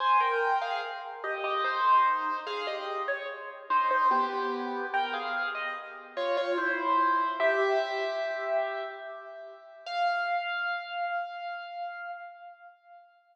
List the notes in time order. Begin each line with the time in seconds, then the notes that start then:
0.00 C5 G#5
0.20 A#4 G5
0.62 G#4 F5
1.24 G4 D#5
1.44 G4 D#5
1.64 D#4 C5
2.47 G#4 F5
2.67 G4 D#5
3.08 C#5
3.70 D#4 C5
3.91 D#4 C5
4.11 B3 G4
4.94 A#4 G5
5.14 G#4 F5
5.55 D#5
6.17 F4 C#5
6.37 F4 C#5
6.58 E4 C5
7.40 G4 E5
9.86 F5